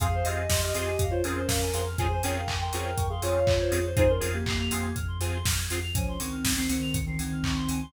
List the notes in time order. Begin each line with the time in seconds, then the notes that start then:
0.00 F2 C4 F4 G#4 F5, kick, closed hi-hat
0.14 C5
0.24 F2 C4 F4 G4 G#4 D#5 F5, open hi-hat
0.36 G#5
0.49 F2 C6, kick, snare
0.61 G4 D#5 F6
0.74 F2 C4 F4 G4 G#4 D#5 C6, open hi-hat
0.86 G#5
0.99 F2 F5, kick, closed hi-hat
1.10 F4 C5 C#5
1.24 F2 C4 C#4 F4 G#4 A#4, open hi-hat
1.36 C5
1.47 F2 F5, kick, snare
1.62 G#5
1.73 F2 C4 F4 G#4 C6, open hi-hat
1.87 F6
1.98 F2 C4 C#4 F4 G#4 C5 G#5, kick, closed hi-hat
2.11 C5
2.23 F2 C4 C#4 F4 G#4 A#4 C#5 G5, open hi-hat
2.35 F5
2.47 F2 G#5, kick, clap
2.61 A#4 G5 C6
2.72 F2 C4 C#4 F4 G#4 A#4 G5 C#6, open hi-hat
2.84 F6
2.97 F2 C#6, kick, closed hi-hat
3.10 G#4 F5 C6
3.22 F2 C4 C#4 F4 G#4 C#5 G#5, open hi-hat
3.36 F5
3.46 F2 C#5, kick, clap
3.60 C5
3.71 F2 C4 C#4 F4 G#4, open hi-hat
3.86 C5
3.96 F2 C4 D#4 F4 G#4 C5 G#5, kick, closed hi-hat
4.08 C#4 A#4 C6
4.20 F2 C4 F4 G#4 F6, open hi-hat
4.33 A#3 G4 G#6
4.46 F2 A#3 G4 C7, kick, clap
4.59 A#3 G4 F7
4.71 F2 C4 F4 G#4 C7, open hi-hat
4.82 G#6
4.95 F2 F6, kick, closed hi-hat
5.08 C6
5.20 F2 C4 F4 G#4 G#5, open hi-hat
5.34 C6
5.45 F2 F6, kick, snare
5.57 G#6
5.70 F2 C4 F4 G#4 C7, open hi-hat
5.82 F7
5.94 C#2 F3 C#4 G#5, kick, closed hi-hat
6.08 C6
6.19 C#2 D#3 C4 C#6, open hi-hat
6.32 F6
6.45 C#2 G#6, kick, snare
6.56 D#3 C4 C7
6.69 C#2 D#3 C4 C#7, open hi-hat
6.81 F7
6.94 C#2 C#7, kick, closed hi-hat
7.06 D#3 C4 C7
7.19 C#2 D#3 C4 G#6, open hi-hat
7.32 F6
7.43 C#2 C#6, kick, clap
7.56 C6
7.68 C#2 G#5, open hi-hat
7.82 C6